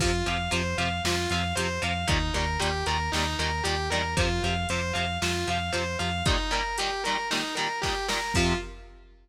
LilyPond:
<<
  \new Staff \with { instrumentName = "Distortion Guitar" } { \time 4/4 \key f \dorian \tempo 4 = 115 f'8 f''8 c''8 f''8 f'8 f''8 c''8 f''8 | ees'8 bes'8 g'8 bes'8 ees'8 bes'8 g'8 bes'8 | f'8 f''8 c''8 f''8 f'8 f''8 c''8 f''8 | ees'8 bes'8 g'8 bes'8 ees'8 bes'8 g'8 bes'8 |
f'4 r2. | }
  \new Staff \with { instrumentName = "Overdriven Guitar" } { \clef bass \time 4/4 \key f \dorian <c f>8 <c f>8 <c f>8 <c f>8 <c f>8 <c f>8 <c f>8 <c f>8 | <bes, ees g>8 <bes, ees g>8 <bes, ees g>8 <bes, ees g>8 <bes, ees g>8 <bes, ees g>8 <bes, ees g>8 <bes, ees g>8 | <c f>8 <c f>8 <c f>8 <c f>8 <c f>8 <c f>8 <c f>8 <c f>8 | <bes, ees g>8 <bes, ees g>8 <bes, ees g>8 <bes, ees g>8 <bes, ees g>8 <bes, ees g>8 <bes, ees g>8 <bes, ees g>8 |
<c f>4 r2. | }
  \new Staff \with { instrumentName = "Synth Bass 1" } { \clef bass \time 4/4 \key f \dorian f,8 f,8 f,8 f,8 f,8 f,8 f,8 f,8 | ees,8 ees,8 ees,8 ees,8 ees,8 ees,8 ees,8 e,8 | f,8 f,8 f,8 f,8 f,8 f,8 f,8 f,8 | r1 |
f,4 r2. | }
  \new DrumStaff \with { instrumentName = "Drums" } \drummode { \time 4/4 <cymc bd>8 hh8 hh8 hh8 sn8 hh8 hh8 hh8 | <hh bd>8 hh8 hh8 hh8 sn8 hh8 hh8 hh8 | <hh bd>8 hh8 hh8 hh8 sn8 hh8 hh8 hh8 | <hh bd>8 hh8 hh8 hh8 sn8 hh8 <bd sn>8 sn8 |
<cymc bd>4 r4 r4 r4 | }
>>